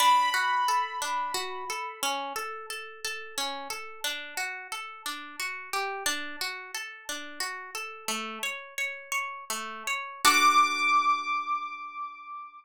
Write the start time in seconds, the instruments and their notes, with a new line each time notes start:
0.00 orchestral harp D4, acoustic grand piano B5
0.34 orchestral harp F#4
0.68 orchestral harp A4
1.02 orchestral harp D4
1.34 orchestral harp F#4
1.70 orchestral harp A4
2.03 orchestral harp C#4
2.36 orchestral harp A4
2.70 orchestral harp A4
3.04 orchestral harp A4
3.38 orchestral harp C#4
3.70 orchestral harp A4
4.04 orchestral harp D4
4.37 orchestral harp F#4
4.72 orchestral harp A4
5.06 orchestral harp D4
5.40 orchestral harp F#4
5.73 orchestral harp G4
6.06 orchestral harp D4
6.41 orchestral harp F#4
6.74 orchestral harp A4
7.09 orchestral harp D4
7.40 orchestral harp F#4
7.75 orchestral harp A4
8.08 orchestral harp A3
8.43 orchestral harp C#5
8.78 orchestral harp C#5
9.12 orchestral harp C#5
9.50 orchestral harp A3
9.87 orchestral harp C#5
10.25 orchestral harp D4 F#4 A4, acoustic grand piano D6